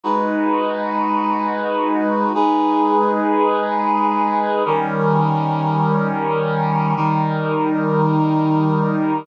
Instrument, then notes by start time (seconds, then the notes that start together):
brass section
0.03 G#3 D#4 F#4 B4
2.34 G#3 D#4 G#4 B4
4.65 D#3 G3 C#4 A#4
6.96 D#3 G3 D#4 A#4